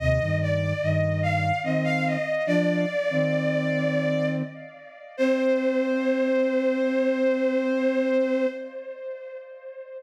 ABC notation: X:1
M:3/4
L:1/16
Q:1/4=73
K:Cm
V:1 name="Violin"
e2 d d e2 f2 e f e2 | "^rit." d10 z2 | c12 |]
V:2 name="Flute"
[E,,C,] [G,,E,]3 [G,,E,]4 [E,C]3 z | "^rit." [F,D]2 z [E,C]7 z2 | C12 |]